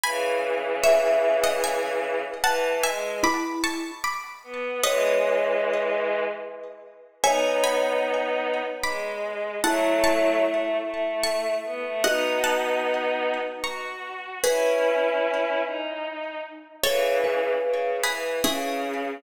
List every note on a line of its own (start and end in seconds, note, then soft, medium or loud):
0.04 2.20 C#3 medium
0.04 2.20 E3 medium
0.04 0.68 G#5 medium
0.04 0.68 B5 medium
0.84 1.38 C#5 medium
0.84 1.38 E5 medium
0.84 1.49 E5 medium
1.44 1.63 D#5 medium
1.44 1.63 F#5 medium
1.64 2.31 E5 medium
1.64 2.31 G#5 medium
2.44 2.81 E3 medium
2.44 2.77 F#5 medium
2.44 2.77 A5 medium
2.83 3.19 G#3 medium
2.83 3.16 E5 medium
2.83 3.16 G#5 medium
3.23 3.91 E4 medium
3.23 3.58 B5 medium
3.23 3.58 D6 medium
3.64 3.98 A5 medium
3.64 3.98 C#6 medium
4.04 4.80 B5 medium
4.04 4.80 D6 medium
4.43 4.80 B3 medium
4.83 6.22 E3 medium
4.83 6.22 G#3 medium
4.83 5.80 B4 medium
4.83 5.96 C#5 medium
4.83 5.80 D#5 medium
7.23 8.60 B3 medium
7.23 8.60 D#4 medium
7.23 9.47 C#5 medium
7.23 7.61 E5 medium
7.23 7.61 G#5 medium
7.64 8.73 G#5 medium
7.64 8.73 B5 medium
8.83 9.55 G#3 medium
8.83 9.54 B5 medium
8.83 9.54 D6 medium
9.64 10.42 F#3 medium
9.64 10.42 A3 medium
9.64 11.95 E4 medium
9.64 10.00 F#5 medium
9.64 10.00 A5 medium
10.04 11.08 A5 medium
10.04 11.08 C#6 medium
10.43 10.76 A3 medium
10.84 11.54 A3 medium
11.24 11.95 A5 medium
11.24 11.95 C#6 medium
11.64 11.83 B3 medium
11.85 12.04 A3 medium
12.04 13.36 B3 medium
12.04 13.36 D#4 medium
12.04 14.08 F#4 medium
12.04 12.42 D#5 medium
12.04 12.42 F#5 medium
12.44 13.60 F#5 medium
12.44 13.60 A5 medium
13.63 14.38 F#4 medium
13.63 14.37 A#5 soft
13.63 14.37 C#6 medium
14.44 15.60 C#4 medium
14.44 15.60 E4 medium
14.44 15.92 G#4 medium
14.44 15.78 B4 medium
14.44 15.92 B4 medium
15.64 16.38 D#4 medium
16.84 17.52 C#3 medium
16.84 17.52 E3 medium
16.84 17.87 A4 medium
16.84 17.16 C#5 medium
16.84 17.87 C#5 medium
17.24 18.20 B4 medium
17.63 17.96 C#3 medium
18.04 18.40 E3 medium
18.04 18.36 G#4 medium
18.04 18.36 B4 medium
18.43 19.13 C#3 medium
18.43 19.17 C#4 medium
18.43 19.14 E4 medium
18.43 19.14 G#4 medium